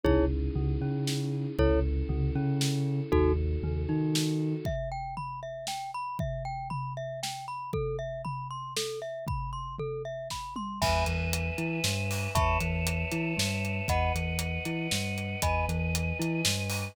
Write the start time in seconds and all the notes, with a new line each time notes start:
0.04 C#2 C#4 D#4 E4 G#4 C#5, kick, floor tom
0.55 C#2 C#3, floor tom
0.81 C#3 C#4
1.07 snare
1.59 C#2 C#4 E4 A4 C#5, kick, floor tom
2.09 C#2 C#3, floor tom
2.35 C#3 C#4
2.61 snare
3.12 D#2 D#4 F#4 A4, kick, floor tom
3.63 D#2 D#3, floor tom
3.89 D#3 D#4
4.15 snare
4.65 E5, kick, floor tom
4.92 G5
5.17 B5, floor tom
5.43 E5
5.67 G5, snare
5.94 B5
6.19 E5, kick, floor tom
6.45 G5
6.70 B5, floor tom
6.97 E5
7.23 G5, snare
7.48 B5
7.73 A4, kick, floor tom
7.99 E5
8.25 B5, floor tom
8.51 C6
8.77 A4, snare
9.02 E5
9.27 B5, kick, floor tom
9.53 C6
9.79 A4, floor tom
10.05 E5
10.30 B5, kick, snare
10.56 C6, mid tom
10.81 E2 B4 E5 G#5 B5, kick, crash
11.06 E2 E3, closed hi-hat
11.33 closed hi-hat
11.58 E3 E4, closed hi-hat
11.84 G2 G3, snare
12.11 open hi-hat
12.35 E2 B4 C#5 E5 A5 B5 C#6, kick, closed hi-hat
12.61 E2 E3, closed hi-hat
12.87 closed hi-hat
13.12 E3 E4, closed hi-hat
13.37 G2 G3, snare
13.65 closed hi-hat
13.88 E2 B4 D#5 F#5 B5, kick, closed hi-hat
14.15 E2 E3, closed hi-hat
14.39 closed hi-hat
14.65 E3 E4, closed hi-hat
14.91 G2 G3, snare
15.18 closed hi-hat
15.42 E2 B4 D#5 G#5 B5, kick, closed hi-hat
15.69 E2 E3, closed hi-hat
15.95 closed hi-hat
16.19 E3 E4, closed hi-hat
16.45 G2 G3, snare
16.70 open hi-hat